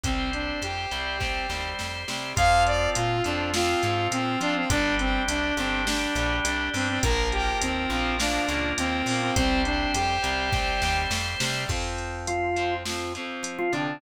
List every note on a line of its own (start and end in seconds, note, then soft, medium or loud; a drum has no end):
0.03 0.53 C2 medium
0.03 0.86 G3 medium
0.03 0.30 C4 loud
0.03 0.86 C4 medium
0.03 2.33 G4 medium
0.03 2.33 C5 medium
0.03 kick loud
0.03 closed hi-hat loud
0.33 0.60 D4 medium
0.33 closed hi-hat medium
0.62 0.86 F2 medium
0.62 1.68 G4 medium
0.62 closed hi-hat loud
0.91 1.41 C2 medium
0.91 1.18 G3 medium
0.91 1.18 C4 medium
0.91 closed hi-hat medium
1.20 1.47 G3 medium
1.20 1.47 C4 medium
1.20 kick medium
1.20 snare medium
1.49 1.74 D#2 medium
1.49 2.03 G3 medium
1.49 2.03 C4 medium
1.49 snare medium
1.79 2.05 F2 medium
1.79 snare loud
2.08 2.33 C3 medium
2.08 2.35 G3 medium
2.08 2.35 C4 medium
2.08 snare loud
2.36 2.88 F2 loud
2.36 3.17 F3 loud
2.36 4.65 C4 medium
2.36 3.17 C4 loud
2.36 4.65 F4 medium
2.36 2.63 F5 loud
2.36 kick loud
2.36 closed hi-hat loud
2.66 2.90 D5 loud
2.66 closed hi-hat medium
2.95 3.21 A#2 loud
2.95 3.22 F4 loud
2.95 closed hi-hat loud
3.24 3.75 F2 loud
3.24 3.51 F3 medium
3.24 3.51 C4 medium
3.24 3.50 D4 medium
3.24 closed hi-hat medium
3.54 3.82 F3 medium
3.54 3.82 C4 medium
3.54 4.07 F4 loud
3.54 snare loud
3.83 4.08 G#2 loud
3.83 4.37 F3 medium
3.83 4.37 C4 medium
3.83 closed hi-hat medium
4.12 4.36 A#2 medium
4.12 4.39 C4 loud
4.12 closed hi-hat loud
4.41 4.65 F3 medium
4.41 4.68 F3 medium
4.41 4.68 C4 medium
4.41 4.55 D4 loud
4.41 closed hi-hat loud
4.56 4.69 C4 loud
4.70 5.19 G1 loud
4.70 5.50 G3 loud
4.70 6.98 D4 loud
4.70 4.95 D4 loud
4.70 5.50 D4 loud
4.70 6.98 G4 medium
4.70 kick loud
4.70 closed hi-hat loud
4.99 5.23 C4 loud
4.99 closed hi-hat loud
5.28 5.53 C2 loud
5.28 5.54 D4 loud
5.28 closed hi-hat loud
5.57 6.07 G1 loud
5.57 5.85 G3 medium
5.57 5.82 C4 loud
5.57 5.85 D4 medium
5.57 closed hi-hat medium
5.87 6.14 G3 medium
5.87 6.37 D4 loud
5.87 6.14 D4 medium
5.87 snare loud
6.15 6.40 A#1 loud
6.15 6.70 G3 medium
6.15 6.70 D4 medium
6.15 closed hi-hat loud
6.45 6.69 C2 loud
6.45 6.69 D4 loud
6.45 closed hi-hat loud
6.73 6.99 G2 medium
6.73 7.00 G3 medium
6.73 6.88 C4 loud
6.73 7.00 D4 medium
6.73 open hi-hat medium
6.89 7.02 C4 loud
7.03 7.53 A#1 loud
7.03 7.85 F3 medium
7.03 7.85 A#3 loud
7.03 9.31 F4 medium
7.03 9.31 A#4 loud
7.03 7.28 A#4 loud
7.03 kick loud
7.03 closed hi-hat loud
7.32 7.58 G4 loud
7.32 closed hi-hat medium
7.61 7.87 D#2 medium
7.61 7.90 C4 loud
7.61 closed hi-hat loud
7.90 8.39 A#1 loud
7.90 8.17 F3 medium
7.90 8.17 A#3 medium
7.90 8.15 C4 loud
8.19 8.46 F3 medium
8.19 8.46 A#3 medium
8.19 8.71 D4 loud
8.19 snare loud
8.19 closed hi-hat loud
8.48 8.73 C#2 loud
8.48 9.01 F3 medium
8.48 9.01 A#3 medium
8.48 closed hi-hat medium
8.78 9.03 D#2 loud
8.78 9.06 C4 loud
8.78 closed hi-hat loud
9.06 9.31 A#2 medium
9.06 9.35 F3 medium
9.06 9.35 A#3 medium
9.06 9.21 C4 loud
9.06 open hi-hat loud
9.22 9.35 C4 loud
9.36 9.86 C2 loud
9.36 10.17 G3 medium
9.36 9.62 C4 loud
9.36 10.17 C4 loud
9.36 11.64 G4 medium
9.36 11.64 C5 loud
9.36 kick loud
9.36 closed hi-hat loud
9.65 9.92 D4 loud
9.65 closed hi-hat medium
9.94 10.19 F2 loud
9.94 11.00 G4 loud
9.94 closed hi-hat loud
10.22 10.73 C2 medium
10.22 10.49 G3 medium
10.22 10.49 C4 medium
10.22 closed hi-hat loud
10.53 10.81 G3 medium
10.53 10.81 C4 medium
10.53 kick loud
10.53 snare loud
10.82 11.06 D#2 loud
10.82 11.37 G3 medium
10.82 11.37 C4 medium
10.82 snare loud
11.10 11.35 F2 medium
11.10 snare loud
11.40 11.65 C3 loud
11.40 11.68 G3 medium
11.40 11.68 C4 medium
11.40 snare loud
11.69 13.17 F2 medium
11.69 12.50 F3 medium
11.69 12.50 C4 medium
11.69 kick loud
11.69 crash loud
11.98 closed hi-hat medium
12.27 12.74 F3 medium
12.27 12.74 F4 medium
12.27 closed hi-hat loud
12.56 12.83 F3 medium
12.56 12.83 C4 medium
12.56 closed hi-hat medium
12.85 13.13 F3 medium
12.85 13.13 C4 medium
12.85 snare loud
13.15 13.69 F3 medium
13.15 13.69 C4 medium
13.15 closed hi-hat medium
13.43 13.68 F3 medium
13.43 closed hi-hat loud
13.58 13.72 F3 medium
13.58 13.72 F4 medium
13.72 13.97 C3 medium
13.72 13.99 D3 medium
13.72 13.99 F3 medium
13.72 13.99 C4 medium
13.72 13.99 D4 medium
13.72 closed hi-hat medium